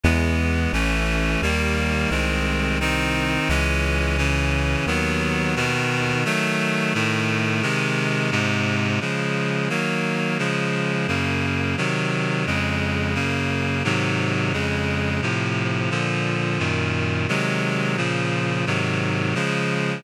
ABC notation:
X:1
M:4/4
L:1/8
Q:1/4=87
K:C#m
V:1 name="Clarinet"
[E,G,B,]2 | [E,A,C]2 [D,=G,^A,]2 [D,^G,^B,]2 [D,B,D]2 | [E,G,C]2 [C,E,C]2 [D,F,B,]2 [B,,D,B,]2 | [D,F,A,]2 [A,,D,A,]2 [^B,,D,G,]2 [G,,B,,G,]2 |
[K:Db] [D,F,A,]2 [E,G,B,]2 [D,F,A,]2 [G,,D,B,]2 | [C,E,G,]2 [F,,D,A,]2 [G,,D,B,]2 [A,,C,E,G,]2 | [F,,D,A,]2 [=A,,C,F,]2 [B,,=D,F,]2 [G,,B,,E,]2 | [C,E,G,A,]2 [B,,D,F,]2 [A,,C,E,G,]2 [D,F,A,]2 |]
V:2 name="Synth Bass 1" clef=bass
E,,2 | A,,,2 D,,2 ^B,,,4 | C,,4 D,,4 | z8 |
[K:Db] z8 | z8 | z8 | z8 |]